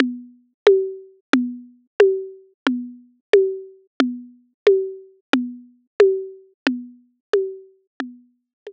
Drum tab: CG |O--o--|O--o--|O--o--|O--o--|

CG |O--o--|O--o--|O--o--|